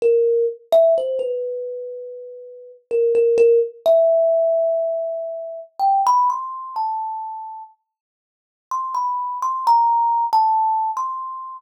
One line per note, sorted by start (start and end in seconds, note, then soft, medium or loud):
0.02 0.46 A#4 medium
0.72 0.94 E5 loud
0.98 1.20 C5 medium
1.19 2.72 B4 medium
2.91 3.13 A#4 medium
3.15 3.37 A#4 medium
3.38 3.59 A#4 loud
3.86 5.60 E5 loud
5.79 6.01 G5 medium
6.07 6.28 B5 loud
6.30 6.73 C6 medium
6.76 7.63 A5 soft
8.71 8.93 C6 medium
8.95 9.38 B5 medium
9.42 9.64 C6 medium
9.67 10.25 A#5 loud
10.33 10.91 A5 medium
10.97 11.55 C6 medium